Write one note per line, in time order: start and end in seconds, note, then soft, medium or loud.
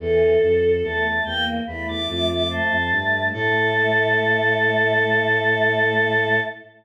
0.00 0.37 E2 medium
0.00 0.35 E3 loud
0.00 0.72 A4 loud
0.00 1.07 A4 medium
0.42 0.82 F2 medium
0.83 1.20 E2 medium
0.83 1.23 A3 medium
0.83 1.24 A5 medium
1.25 1.59 E2 medium
1.25 1.61 A#3 loud
1.25 1.44 G5 loud
1.67 1.86 E2 medium
1.67 2.73 A3 medium
1.67 2.02 E4 medium
1.67 1.87 B5 loud
1.87 2.07 E2 medium
1.87 2.07 D6 loud
2.08 2.60 F2 medium
2.08 2.43 F4 medium
2.08 2.27 D6 loud
2.29 2.49 D6 medium
2.50 2.90 C5 medium
2.50 3.25 A5 medium
2.71 2.91 F2 medium
2.92 3.32 G2 medium
2.92 3.29 A3 medium
3.33 6.40 A2 loud
3.33 6.40 A3 loud
3.33 6.39 A4 loud
3.33 6.40 A5 loud